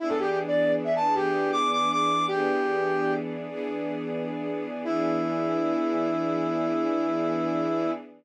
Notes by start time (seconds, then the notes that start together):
0.00 E3 B3 D4 E4 G#4
0.09 A4
0.19 G4
0.29 G4
0.47 D5
0.84 E5
0.96 A5
1.14 E3 B3 D4 G4 G#4
1.52 D6
1.73 D6
1.92 D6
2.28 E3 B3 D4 G4 G#4
3.48 E3 B3 D4 G#4
4.84 E3 B3 D4 E4 G#4